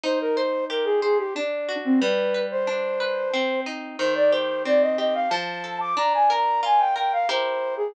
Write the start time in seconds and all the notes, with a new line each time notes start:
0.04 D#4 C5
0.21 A#4
0.36 C5
0.70 G4 A#4
0.85 G#4
1.02 G#4 C5
1.18 G4
1.35 D4
1.69 F#4
1.84 C4
2.01 G3 B4
2.34 B4
2.51 C5
2.67 D4
3.00 B4
3.34 C4
3.66 D#4
3.99 D#3 C5
4.15 D5
4.31 G4 C5
4.65 C4 D5
4.82 D#5
4.98 G4 D#5
5.14 F5
5.30 F3 A5
5.64 A4
5.80 D6
5.97 D4 A#5
6.14 G#5
6.30 A#4 A#5
6.63 F4 G#5
6.79 G5
6.96 A#4 G5
7.13 F5
7.29 E4 G4 A#4 C5
7.77 G#4